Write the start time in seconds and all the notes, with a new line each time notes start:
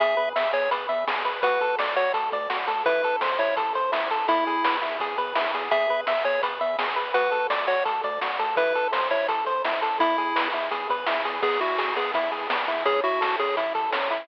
0.00 E2 G#4 E5, kick, closed hi-hat
0.17 E2 B4
0.36 E2 E5, snare, closed hi-hat
0.53 E2 G#4 C#5, closed hi-hat
0.71 E2 B4, kick, closed hi-hat
0.89 E2 E5, closed hi-hat
1.07 E2 G#4, snare
1.25 E2 B4, closed hi-hat
1.42 D2 F#4 B4, kick, closed hi-hat
1.61 D2 A4, closed hi-hat
1.79 D2 D5, snare
1.96 D2 F#4 C#5, closed hi-hat
2.14 D2 A4, kick, closed hi-hat
2.32 D2 D5, kick, closed hi-hat
2.50 D2 F#4, snare
2.67 D2 A4, closed hi-hat
2.86 A1 E4 B4, kick, closed hi-hat
3.03 A1 A4, closed hi-hat
3.21 A1 C5, snare
3.39 A1 E4 C#5, closed hi-hat
3.56 A1 A4, kick, closed hi-hat
3.74 A1 C5, closed hi-hat
3.92 A1 E4, snare
4.11 A1 A4, closed hi-hat
4.28 E2 E4, kick, closed hi-hat
4.47 E2 G#4, closed hi-hat
4.64 E2 B4, snare
4.82 E2 E4, closed hi-hat
5.00 E2 G#4, kick, closed hi-hat
5.17 E2 B4, kick, closed hi-hat
5.35 E2 E4, snare
5.54 E2 G#4, closed hi-hat
5.71 E2 G#4 E5, kick, closed hi-hat
5.89 E2 B4
6.07 E2 E5, snare, closed hi-hat
6.24 E2 G#4 C#5, closed hi-hat
6.43 E2 B4, kick, closed hi-hat
6.61 E2 E5, closed hi-hat
6.79 E2 G#4, snare
6.96 E2 B4, closed hi-hat
7.14 D2 F#4 B4, kick, closed hi-hat
7.31 D2 A4, closed hi-hat
7.50 D2 D5, snare
7.67 D2 F#4 C#5, closed hi-hat
7.85 D2 A4, kick, closed hi-hat
8.03 D2 D5, kick, closed hi-hat
8.21 D2 F#4, snare
8.39 D2 A4, closed hi-hat
8.57 A1 E4 B4, kick, closed hi-hat
8.75 A1 A4, closed hi-hat
8.92 A1 C5, snare
9.10 A1 E4 C#5, closed hi-hat
9.28 A1 A4, kick, closed hi-hat
9.46 A1 C5, closed hi-hat
9.64 A1 E4, snare
9.82 A1 A4, closed hi-hat
9.99 E2 E4, kick, closed hi-hat
10.18 E2 G#4, closed hi-hat
10.36 E2 B4, snare
10.53 E2 E4, closed hi-hat
10.71 E2 G#4, kick, closed hi-hat
10.89 E2 B4, kick, closed hi-hat
11.06 E2 E4, snare
11.25 E2 G#4, closed hi-hat
11.42 E2 B3 G#4, kick, crash
11.61 E2 E4 F#4, closed hi-hat
11.78 E2 G#4, snare
11.96 E2 B3 G#4, closed hi-hat
12.14 E2 E4, kick, closed hi-hat
12.32 E2 G#4, closed hi-hat
12.50 E2 B3, snare
12.68 E2 E4, closed hi-hat
12.85 A1 C#4 G#4, kick, closed hi-hat
13.04 A1 E4 F#4, closed hi-hat
13.21 A1 A4, snare
13.39 A1 C#4 G#4, closed hi-hat
13.57 A1 E4, kick, closed hi-hat
13.75 A1 A4, kick, closed hi-hat
13.92 A1 C#4, snare
14.10 A1 E4, closed hi-hat